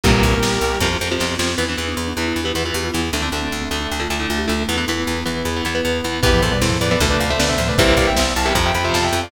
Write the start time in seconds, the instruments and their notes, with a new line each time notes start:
0.03 electric bass (finger) C2, overdriven guitar G2 A#2 C3 E3, marimba A#2 G3, pad 5 (bowed) G3 A#3 C4 E4, distortion guitar G4 A#4, kick, closed hi-hat
0.22 electric bass (finger) C2, marimba A#2 G3, kick, closed hi-hat
0.43 electric bass (finger) C2, pad 5 (bowed) G3 A#3 E4 G4, snare
0.61 electric bass (finger) C2, closed hi-hat
0.80 electric bass (finger) F2, overdriven guitar C3 F3, pad 5 (bowed) C4 F4, kick, snare
1.01 electric bass (finger) F2, overdriven guitar C3 F3
1.11 overdriven guitar C3 F3
1.20 electric bass (finger) F2, snare
1.39 electric bass (finger) F2, overdriven guitar C3 F3, snare
1.58 electric bass (finger) E2, overdriven guitar E3 B3, pad 5 (bowed) B3 E4, marimba E4
1.69 overdriven guitar E3 B3, marimba D4
1.77 electric bass (finger) E2, overdriven guitar E3 B3
1.88 marimba D4
1.97 electric bass (finger) E2
2.08 marimba D4
2.17 electric bass (finger) E2, overdriven guitar E3 B3
2.28 marimba E4
2.36 electric bass (finger) E2
2.44 overdriven guitar E3 B3, marimba G4
2.55 electric bass (finger) E2, overdriven guitar E3 B3
2.64 overdriven guitar E3 B3, marimba F4
2.74 electric bass (finger) E2, marimba G4
2.85 marimba F4
2.94 electric bass (finger) E2, overdriven guitar E3 B3, marimba E4
3.13 electric bass (finger) D2, overdriven guitar D3 A3, pad 5 (bowed) A3 D4, marimba D4
3.22 overdriven guitar D3 A3, marimba C4
3.32 electric bass (finger) D2, overdriven guitar D3 A3
3.42 marimba C4
3.52 electric bass (finger) D2
3.62 marimba C4
3.71 electric bass (finger) D2, overdriven guitar D3 A3
3.81 marimba D4
3.91 electric bass (finger) D2
4.00 overdriven guitar D3 A3, marimba F4
4.10 electric bass (finger) D2, overdriven guitar D3 A3
4.20 overdriven guitar D3 A3, marimba E4
4.29 electric bass (finger) D2, marimba F4
4.38 marimba G4
4.47 electric bass (finger) D2, overdriven guitar D3 A3, marimba F4
4.68 electric bass (finger) E2, overdriven guitar E3 B3, pad 5 (bowed) B3 E4, marimba E4
4.78 overdriven guitar E3 B3
4.88 electric bass (finger) E2, overdriven guitar E3 B3
5.07 electric bass (finger) E2
5.26 electric bass (finger) E2, overdriven guitar E3 B3
5.45 electric bass (finger) E2
5.56 overdriven guitar E3 B3
5.65 electric bass (finger) E2, overdriven guitar E3 B3
5.75 overdriven guitar E3 B3
5.85 electric bass (finger) E2
6.04 electric bass (finger) E2, overdriven guitar E3 B3
6.23 electric bass (finger) E2, marimba G2 E3, overdriven guitar E3 B3, pad 5 (bowed) B3 E4, distortion guitar G4 B4, kick, crash
6.33 marimba A2 F3
6.42 electric bass (finger) E2, distortion guitar A4 C5, kick, closed hi-hat
6.52 marimba B2 G3, distortion guitar B4 D5
6.62 electric bass (finger) E2, distortion guitar A4 C5, snare
6.70 marimba A2 F3
6.80 electric bass (finger) E2, marimba A2 F3, distortion guitar B4 D5, closed hi-hat
6.91 overdriven guitar E3 B3, distortion guitar B4 D5
7.00 electric bass (finger) D2, marimba C3 A3, overdriven guitar D3 A3, pad 5 (bowed) A3 D4, kick, closed hi-hat
7.10 distortion guitar B4 D5
7.20 electric bass (finger) D2, distortion guitar D5 F5, closed hi-hat
7.30 overdriven guitar D3 A3, distortion guitar C5 E5
7.38 electric bass (finger) D2, marimba D3 B3, distortion guitar B4 D5, snare
7.49 marimba C3 A3, distortion guitar C5 E5
7.58 electric bass (finger) D2, marimba A2 F3, closed hi-hat
7.68 marimba C3 A3, distortion guitar B4 D5
7.78 electric bass (finger) C2, overdriven guitar C3 E3 G3 A#3, pad 5 (bowed) G3 A#3 C4 E4, marimba A#3 G4, distortion guitar C5 E5, kick, closed hi-hat
7.97 electric bass (finger) C2, distortion guitar D5 F5, kick, closed hi-hat
8.07 distortion guitar E5 G5
8.17 electric bass (finger) C2, pad 5 (bowed) G3 A#3 E4 G4, distortion guitar C5 E5, snare
8.36 electric bass (finger) C2, distortion guitar F5 A5, closed hi-hat
8.46 overdriven guitar C3 E3 G3 A#3, distortion guitar E5 G5
8.55 electric bass (finger) F2, overdriven guitar C3 F3, pad 5 (bowed) C4 F4, kick, closed hi-hat
8.65 distortion guitar E5 G5
8.75 electric bass (finger) F2, distortion guitar G5 B5, closed hi-hat
8.84 overdriven guitar C3 F3, distortion guitar C5 E5
8.94 electric bass (finger) F2, distortion guitar F5 A5, snare
9.04 distortion guitar E5 G5
9.13 electric bass (finger) F2, open hi-hat
9.23 distortion guitar D5 F5